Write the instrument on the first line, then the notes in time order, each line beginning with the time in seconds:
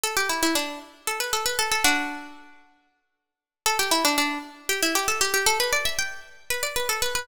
pizzicato strings
0.03 A4
0.17 G4
0.29 E4
0.43 E4
0.55 D4
1.07 A4
1.20 B4
1.33 A4
1.46 B4
1.59 A4
1.71 A4
1.84 D4 F#4
3.66 A4
3.79 G4
3.91 E4
4.05 D4
4.18 D4
4.69 G4
4.82 E4
4.95 G4
5.08 A4
5.21 G4
5.34 G4
5.46 A4
5.60 B4
5.73 D5
5.85 E5
5.99 G5
6.50 B4
6.63 D5
6.76 B4
6.89 A4
7.02 B4
7.15 B4